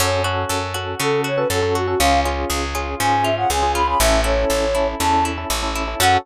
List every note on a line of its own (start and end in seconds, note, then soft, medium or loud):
0.00 0.45 F#2 loud
0.00 0.99 C#4 loud
0.00 0.20 C#4 medium
0.00 0.20 F#4 medium
0.00 0.20 A4 medium
0.00 0.23 C#5 medium
0.24 0.65 C#4 medium
0.24 0.74 F#4 medium
0.24 0.65 F#4 medium
0.24 0.65 A4 medium
0.49 0.95 F#2 medium
0.49 1.49 A4 medium
0.74 0.95 C#4 medium
0.74 1.24 F#4 medium
0.74 0.95 F#4 medium
0.74 0.95 A4 medium
0.99 1.45 C#3 medium
0.99 1.94 C#4 medium
0.99 1.30 C#4 medium
0.99 1.30 F#4 medium
0.99 1.30 A4 medium
0.99 1.21 A4 medium
1.24 1.75 F#4 medium
1.24 1.39 C#5 medium
1.36 1.48 C#4 medium
1.36 1.48 F#4 medium
1.36 1.48 A4 medium
1.36 1.48 B4 medium
1.50 1.95 F#2 medium
1.50 1.60 C#4 medium
1.50 1.60 F#4 medium
1.50 1.60 A4 medium
1.50 1.97 A4 medium
1.50 1.75 A4 medium
1.62 1.82 C#4 medium
1.62 1.82 F#4 medium
1.62 1.82 A4 medium
1.75 1.99 F#4 medium
1.75 1.87 F#4 medium
1.87 1.97 C#4 medium
1.87 1.99 F#4 medium
1.87 1.97 F#4 medium
1.87 1.97 A4 medium
1.99 2.45 C#2 loud
1.99 2.20 C#4 medium
1.99 3.00 C#4 loud
1.99 2.20 F4 loud
1.99 2.20 G#4 medium
1.99 2.20 F5 medium
2.25 2.65 C#4 medium
2.25 2.65 F4 medium
2.25 2.74 F4 medium
2.25 2.65 G#4 medium
2.50 2.95 C#2 medium
2.50 3.50 G#4 medium
2.75 2.95 C#4 medium
2.75 3.24 F4 medium
2.75 2.95 F4 medium
2.75 2.95 G#4 medium
3.00 3.45 G#2 medium
3.00 3.30 C#4 medium
3.00 3.95 C#4 medium
3.00 3.30 F4 medium
3.00 3.30 G#4 medium
3.00 3.24 G#5 medium
3.23 3.75 F4 medium
3.23 3.35 E5 medium
3.37 3.48 C#4 medium
3.37 3.48 F4 medium
3.37 3.48 G#4 medium
3.37 3.49 F#5 medium
3.50 3.95 C#2 medium
3.50 3.60 C#4 medium
3.50 3.60 F4 medium
3.50 3.60 G#4 medium
3.50 3.98 G#4 medium
3.50 3.72 G#5 medium
3.62 3.82 C#4 medium
3.62 3.82 F4 medium
3.62 3.82 G#4 medium
3.75 3.99 F4 medium
3.75 3.87 B5 medium
3.87 3.97 C#4 medium
3.87 3.97 F4 medium
3.87 3.97 G#4 medium
3.87 3.99 B5 medium
3.99 4.45 A1 loud
3.99 4.20 C#4 loud
3.99 5.00 C#4 medium
3.99 4.20 E4 loud
3.99 4.20 A4 medium
3.99 4.21 E5 medium
4.24 4.65 C#4 medium
4.24 4.74 E4 medium
4.24 4.65 E4 medium
4.24 4.65 A4 medium
4.24 4.87 C#5 medium
4.50 4.95 A1 medium
4.50 5.50 A4 medium
4.75 4.95 C#4 medium
4.75 5.25 E4 medium
4.75 4.95 E4 medium
4.75 4.95 A4 medium
5.00 5.45 E2 medium
5.00 5.30 C#4 medium
5.00 5.95 C#4 medium
5.00 5.30 E4 medium
5.00 5.30 A4 medium
5.00 5.24 A5 medium
5.25 5.75 E4 medium
5.38 5.48 C#4 medium
5.38 5.48 E4 medium
5.38 5.48 A4 medium
5.50 5.95 A1 medium
5.50 5.60 C#4 medium
5.50 5.60 E4 medium
5.50 5.97 A4 medium
5.50 5.60 A4 medium
5.62 5.83 C#4 medium
5.62 5.83 E4 medium
5.62 5.83 A4 medium
5.75 5.99 E4 medium
5.88 5.98 C#4 medium
5.88 5.98 E4 medium
5.88 5.98 A4 medium
6.00 6.17 F#2 loud
6.00 6.17 C#4 loud
6.00 6.18 C#4 loud
6.00 6.17 F#4 loud
6.00 6.18 F#4 loud
6.00 6.17 A4 loud
6.00 6.18 A4 loud
6.00 6.17 F#5 loud